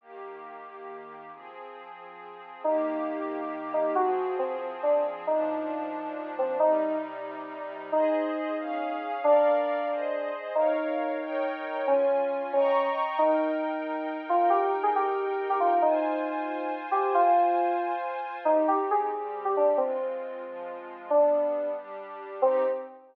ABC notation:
X:1
M:6/8
L:1/16
Q:3/8=91
K:Eb
V:1 name="Electric Piano 2"
z12 | z12 | E10 E2 | _G4 C2 z2 D2 z2 |
E10 C2 | E4 z8 | [K:Ab] E12 | =D12 |
E12 | D6 D4 z2 | [K:Eb] E10 F2 | G2 z A G5 G F2 |
E10 G2 | F8 z4 | [K:Cm] E2 G z A5 G D2 | C10 z2 |
D6 z6 | C6 z6 |]
V:2 name="Pad 5 (bowed)"
[E,B,G]12 | [F,CA]12 | [E,B,G]12 | [F,CA]12 |
[B,,F,D]12 | [C,G,E]12 | [K:Ab] [Ace]6 [DAf]6 | [B=df]6 [Ace]6 |
[Bdf]6 [EBdg]6 | [DFa]6 [egbd']6 | [K:Eb] [EBg]12- | [EBg]12 |
[Fca]12- | [Fca]12 | [K:Cm] [CEG]6 [G,CG]6 | [A,CF]6 [F,A,F]6 |
[G,=B,D]6 [G,DG]6 | [CEG]6 z6 |]